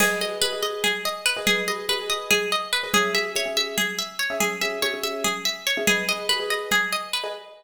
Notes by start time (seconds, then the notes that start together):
0.00 G#4 B4 D#5, crash, low conga
0.21 G#4 B4 D#5, high conga
0.42 G#4 B4 D#5, high conga
0.53 G#4 B4 D#5
0.63 D#5, high conga
0.84 G#4, low conga
1.05 D#5
1.26 B4
1.37 G#4 B4 D#5
1.47 G#4, low conga
1.68 G#4 B4 D#5, high conga
1.89 G#4 B4 D#5, high conga
1.99 G#4 B4 D#5
2.10 D#5
2.31 G#4, low conga
2.52 D#5
2.73 B4
2.83 G#4 B4 D#5
2.93 C#4 G#4 E5, low conga
3.14 C#4 G#4 E5, high conga
3.35 C#4 G#4 C#5 E5, high conga
3.46 C#4 G#4 E5
3.57 E5, high conga
3.78 G#4, low conga
3.99 E5
4.19 C#5
4.30 C#4 G#4 E5
4.40 G#4, low conga
4.61 C#4 G#4 E5, high conga
4.82 C#4 G#4 C#5 E5, high conga
4.94 C#4 G#4 E5
5.03 E5, high conga
5.24 G#4, low conga
5.45 E5
5.67 C#5
5.77 C#4 G#4 E5
5.87 G#4 B4 D#5, low conga
6.09 G#4 B4 D#5
6.29 G#4 B4 D#5, high conga
6.40 G#4 B4 D#5
6.50 D#5
6.71 G#4, low conga
6.92 D#5
7.13 B4
7.24 G#4 B4 D#5